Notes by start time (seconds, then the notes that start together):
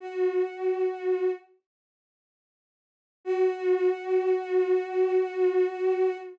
0.00 F#4
3.25 F#4